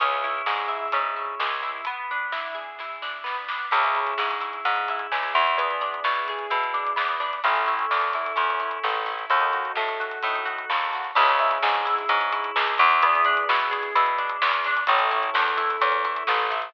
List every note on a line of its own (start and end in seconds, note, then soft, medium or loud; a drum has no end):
0.00 0.42 C#2 medium
0.00 0.92 C#4 loud
0.00 1.68 C#4 medium
0.00 1.68 E4 loud
0.00 1.68 G#4 loud
0.00 kick loud
0.00 closed hi-hat loud
0.24 0.68 E4 medium
0.46 0.88 G#2 medium
0.46 1.40 G#4 medium
0.46 snare loud
0.68 1.16 E4 medium
0.68 kick medium
0.92 1.35 G#2 medium
0.92 1.81 C#4 medium
0.92 kick medium
0.92 closed hi-hat loud
1.16 1.62 E4 medium
1.40 1.81 C#2 medium
1.40 1.84 G#4 medium
1.40 snare loud
1.62 1.85 E4 medium
1.85 3.23 B3 loud
1.85 kick medium
1.85 closed hi-hat medium
2.11 3.02 D4 medium
2.32 2.80 E4 medium
2.32 snare medium
2.55 3.65 G#4 medium
2.79 3.69 E4 medium
2.79 kick medium
2.79 snare medium
3.02 3.49 D4 medium
3.02 snare medium
3.24 3.68 B3 medium
3.24 snare medium
3.48 3.71 D4 medium
3.48 snare medium
3.71 4.14 C#2 medium
3.71 4.66 C#4 medium
3.71 5.40 C#4 medium
3.71 5.40 E4 loud
3.71 5.40 G#4 loud
3.71 kick medium
3.71 crash loud
3.84 closed hi-hat medium
3.95 4.40 E4 medium
3.95 closed hi-hat medium
4.07 closed hi-hat medium
4.18 4.60 G#2 medium
4.18 5.11 G#4 medium
4.18 snare loud
4.31 closed hi-hat medium
4.40 4.89 E4 medium
4.40 closed hi-hat medium
4.53 closed hi-hat medium
4.65 5.07 G#2 medium
4.65 5.55 C#4 medium
4.65 kick medium
4.65 closed hi-hat medium
4.76 closed hi-hat medium
4.88 5.34 E4 medium
4.88 kick medium
4.88 closed hi-hat medium
4.99 closed hi-hat medium
5.12 5.34 C#2 medium
5.12 5.56 G#4 medium
5.12 snare loud
5.23 closed hi-hat medium
5.34 6.00 E2 medium
5.34 5.56 E4 medium
5.34 snare soft
5.34 closed hi-hat medium
5.47 closed hi-hat medium
5.57 7.25 B3 loud
5.57 6.96 B3 loud
5.57 7.25 D4 medium
5.57 7.25 E4 medium
5.57 7.25 G#4 loud
5.57 kick medium
5.57 closed hi-hat medium
5.71 closed hi-hat medium
5.81 6.73 D4 medium
5.81 closed hi-hat medium
5.94 closed hi-hat medium
6.04 6.47 B2 medium
6.04 6.50 E4 medium
6.04 snare loud
6.15 closed hi-hat medium
6.28 7.39 G#4 medium
6.28 kick medium
6.28 closed hi-hat medium
6.39 closed hi-hat medium
6.50 6.93 B2 medium
6.50 7.39 E4 medium
6.50 kick medium
6.50 closed hi-hat medium
6.63 closed hi-hat medium
6.74 7.20 D4 medium
6.74 kick medium
6.74 closed hi-hat medium
6.87 closed hi-hat medium
6.96 7.40 E2 medium
6.96 7.40 B3 medium
6.96 snare loud
7.08 closed hi-hat medium
7.20 7.42 D4 medium
7.20 snare soft
7.20 closed hi-hat medium
7.33 closed hi-hat medium
7.44 7.86 A1 medium
7.44 9.12 C#4 loud
7.44 8.35 C#4 loud
7.44 9.12 E4 loud
7.44 9.12 A4 loud
7.44 kick medium
7.44 closed hi-hat medium
7.56 closed hi-hat medium
7.66 8.14 E4 medium
7.66 closed hi-hat medium
7.79 closed hi-hat medium
7.91 8.33 E2 medium
7.91 8.83 A4 medium
7.91 snare medium
8.01 closed hi-hat medium
8.13 8.60 E4 medium
8.13 kick medium
8.13 closed hi-hat medium
8.26 closed hi-hat medium
8.36 8.79 E2 medium
8.36 9.24 C#4 medium
8.36 kick medium
8.36 closed hi-hat medium
8.50 closed hi-hat medium
8.60 9.06 E4 medium
8.60 kick medium
8.60 closed hi-hat medium
8.71 closed hi-hat medium
8.84 9.26 A1 medium
8.84 9.28 A4 medium
8.84 snare medium
8.94 closed hi-hat medium
9.06 9.29 E4 medium
9.06 snare medium
9.06 closed hi-hat medium
9.19 closed hi-hat medium
9.30 9.72 D#2 medium
9.30 10.97 D#4 loud
9.30 10.24 D#4 loud
9.30 10.97 F#4 loud
9.30 10.97 A4 medium
9.30 kick loud
9.30 closed hi-hat medium
9.41 closed hi-hat medium
9.53 9.99 F#4 medium
9.53 closed hi-hat medium
9.65 closed hi-hat medium
9.75 10.19 A2 medium
9.75 10.69 A4 medium
9.75 snare medium
9.88 closed hi-hat medium
10.00 10.45 F#4 medium
10.00 kick medium
10.00 closed hi-hat medium
10.11 closed hi-hat medium
10.23 10.65 A2 medium
10.23 11.12 D#4 medium
10.23 kick medium
10.23 closed hi-hat medium
10.36 closed hi-hat medium
10.45 10.94 F#4 medium
10.45 kick medium
10.45 closed hi-hat medium
10.58 closed hi-hat medium
10.70 11.12 D#2 medium
10.70 11.14 A4 medium
10.70 snare loud
10.81 closed hi-hat medium
10.93 11.17 F#4 medium
10.93 snare medium
10.93 closed hi-hat medium
11.04 closed hi-hat medium
11.15 11.58 C#2 loud
11.15 11.39 C#4 loud
11.15 12.85 C#4 loud
11.15 12.85 E4 loud
11.15 12.85 G#4 loud
11.15 kick loud
11.15 crash loud
11.28 closed hi-hat medium
11.39 11.63 E4 medium
11.39 closed hi-hat medium
11.51 closed hi-hat medium
11.62 12.05 G#2 medium
11.62 11.86 G#4 medium
11.62 snare loud
11.75 closed hi-hat medium
11.85 12.09 E4 medium
11.85 closed hi-hat medium
11.98 closed hi-hat medium
12.09 12.51 G#2 medium
12.09 12.32 C#4 medium
12.09 kick loud
12.09 closed hi-hat loud
12.21 closed hi-hat medium
12.32 12.56 E4 medium
12.32 kick loud
12.32 closed hi-hat medium
12.44 closed hi-hat medium
12.56 12.78 C#2 medium
12.56 12.79 G#4 medium
12.56 snare loud
12.67 closed hi-hat medium
12.78 13.44 E2 loud
12.78 13.02 E4 medium
12.78 snare medium
12.78 closed hi-hat medium
12.91 closed hi-hat medium
13.02 14.70 B3 loud
13.02 13.26 B3 loud
13.02 14.70 D4 loud
13.02 14.70 E4 loud
13.02 14.70 G#4 loud
13.02 kick loud
13.02 closed hi-hat loud
13.15 closed hi-hat medium
13.25 13.49 D4 loud
13.25 closed hi-hat medium
13.37 closed hi-hat medium
13.49 13.91 B2 medium
13.49 13.72 E4 medium
13.49 snare loud
13.59 closed hi-hat medium
13.71 13.94 G#4 loud
13.71 kick medium
13.71 closed hi-hat medium
13.83 closed hi-hat medium
13.95 14.37 B2 medium
13.95 14.19 E4 medium
13.95 kick loud
13.95 closed hi-hat loud
14.06 closed hi-hat medium
14.18 14.42 D4 medium
14.18 kick medium
14.18 closed hi-hat medium
14.29 closed hi-hat medium
14.42 14.84 E2 medium
14.42 14.65 B3 medium
14.42 snare loud
14.53 closed hi-hat medium
14.65 14.88 D4 loud
14.65 snare medium
14.65 closed hi-hat medium
14.77 closed hi-hat medium
14.87 15.30 A1 medium
14.87 16.56 C#4 loud
14.87 15.12 C#4 loud
14.87 16.56 E4 loud
14.87 16.56 A4 loud
14.87 kick loud
14.87 closed hi-hat loud
14.99 closed hi-hat medium
15.11 15.34 E4 loud
15.11 closed hi-hat medium
15.23 closed hi-hat medium
15.34 15.77 E2 medium
15.34 15.57 A4 medium
15.34 snare loud
15.48 closed hi-hat medium
15.57 15.81 E4 medium
15.57 kick medium
15.57 closed hi-hat medium
15.70 closed hi-hat medium
15.81 16.23 E2 medium
15.81 16.05 C#4 medium
15.81 kick medium
15.81 closed hi-hat loud
15.92 closed hi-hat medium
16.05 16.28 E4 medium
16.05 kick medium
16.05 closed hi-hat medium
16.16 closed hi-hat medium
16.27 16.70 A1 medium
16.27 16.52 A4 medium
16.27 snare loud
16.39 closed hi-hat medium
16.50 16.72 E4 medium
16.50 snare medium
16.50 closed hi-hat medium
16.62 closed hi-hat medium